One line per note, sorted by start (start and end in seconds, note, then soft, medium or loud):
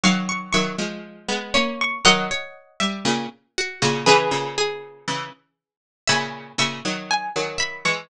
0.04 0.52 D#3 medium
0.04 0.52 F#3 loud
0.04 0.50 F5 medium
0.04 0.27 C#6 loud
0.29 0.51 C#6 loud
0.53 0.76 D#3 medium
0.53 0.76 F#3 loud
0.53 1.53 E5 medium
0.53 0.98 C#6 medium
0.78 1.28 F3 medium
0.78 1.28 G#3 medium
1.28 1.53 G#3 medium
1.28 1.53 B3 loud
1.54 1.99 A#3 medium
1.54 1.99 C#4 medium
1.54 2.02 C#5 medium
1.54 1.78 C#6 medium
1.81 2.04 C#6 loud
2.05 2.30 D#3 loud
2.05 2.30 F#3 loud
2.05 2.28 A#4 medium
2.05 3.03 D#5 loud
2.05 3.03 F#5 loud
2.31 2.77 C#5 medium
2.80 3.05 G3 loud
2.80 3.05 E5 medium
3.05 3.26 A#2 loud
3.05 3.26 C#3 loud
3.58 3.80 F#4 medium
3.82 4.05 A#2 medium
3.82 4.05 C#3 loud
3.82 4.06 F#4 medium
4.06 4.31 C#3 loud
4.06 4.31 E3 loud
4.06 5.75 G#4 medium
4.06 5.75 B4 loud
4.06 4.52 B4 medium
4.31 5.05 A#2 medium
4.31 5.05 C#3 medium
4.58 5.43 G#4 medium
5.08 5.30 C#3 medium
5.08 5.30 E3 medium
6.07 6.53 A#2 medium
6.07 6.53 C#3 loud
6.07 6.56 E5 medium
6.07 6.55 G#5 medium
6.07 6.55 B5 loud
6.58 6.80 A#2 medium
6.58 6.80 C#3 medium
6.58 7.57 E5 medium
6.58 7.06 C#6 medium
6.85 7.29 D#3 medium
6.85 7.29 F#3 medium
7.11 7.54 G#5 medium
7.36 7.84 D#3 medium
7.36 7.84 F#3 medium
7.58 8.05 E5 medium
7.58 7.82 B5 medium
7.85 8.07 E3 medium
7.85 8.07 G#3 loud
7.85 8.08 C#6 medium